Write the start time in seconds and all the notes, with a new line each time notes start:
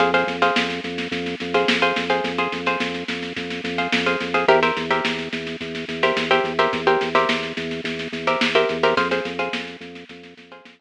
0.00 F2 G#4 C5 F5, kick, snare
0.14 G#4 C5 F5, snare
0.27 F2, snare
0.42 G#4 C5 F5, snare
0.56 F2, snare
0.70 snare
0.84 F2, snare
0.98 snare
1.11 F2, kick, snare
1.26 snare
1.40 F2, snare
1.54 G#4 C5 F5, snare
1.68 F2, snare
1.82 G#4 C5 F5, snare
1.96 F2, snare
2.10 G#4 C5 F5, snare
2.24 F2, kick, snare
2.38 G#4 C5 F5, snare
2.52 F2, snare
2.66 G#4 C5 F5, snare
2.80 F2, snare
2.94 snare
3.08 F2, snare
3.23 snare
3.36 F2, kick, snare
3.50 snare
3.64 F2, snare
3.78 G#4 C5 F5, snare
3.92 F2, snare
4.06 G#4 C5 F5, snare
4.20 F2, snare
4.34 G#4 C5 F5, snare
4.48 E2 G4 A#4 C5 E5, kick, snare
4.63 G4 A#4 C5 E5, snare
4.77 E2, snare
4.91 G4 A#4 C5 E5, snare
5.05 E2, snare
5.19 snare
5.33 E2, snare
5.47 snare
5.61 E2, kick, snare
5.75 snare
5.88 E2, snare
6.03 G4 A#4 C5 E5, snare
6.16 E2, snare
6.31 G4 A#4 C5 E5, snare
6.44 E2, snare
6.59 G4 A#4 C5 E5, snare
6.73 E2, kick, snare
6.87 G4 A#4 C5 E5, snare
7.01 E2, snare
7.15 G4 A#4 C5 E5, snare
7.29 E2, snare
7.43 snare
7.57 E2, snare
7.71 snare
7.84 E2, kick, snare
7.99 snare
8.12 E2, snare
8.27 G4 A#4 C5 E5, snare
8.41 E2, snare
8.55 G4 A#4 C5 E5, snare
8.69 E2, snare
8.83 G4 A#4 C5 E5, snare
8.97 F2 G#4 C5 F5, kick, snare
9.11 G#4 C5 F5, snare
9.25 F2, snare
9.39 G#4 C5 F5, snare
9.53 F2, snare
9.67 snare
9.80 F2, snare
9.95 snare
10.09 F2, kick, snare
10.23 snare
10.37 F2, snare
10.51 G#4 C5 F5, snare
10.65 F2, snare
10.79 G#4 C5 F5, snare